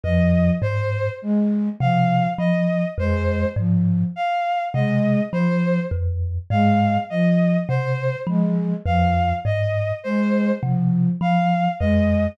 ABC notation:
X:1
M:7/8
L:1/8
Q:1/4=51
K:none
V:1 name="Kalimba" clef=bass
F,, ^G,, z C, F, F,, G,, | z C, F, F,, ^G,, z C, | F, F,, ^G,, z C, F, F,, |]
V:2 name="Flute" clef=bass
F, z ^G, F, z G, F, | z ^G, F, z G, F, z | ^G, F, z G, F, z G, |]
V:3 name="Violin"
^d c z f d c z | f ^d c z f d c | z f ^d c z f d |]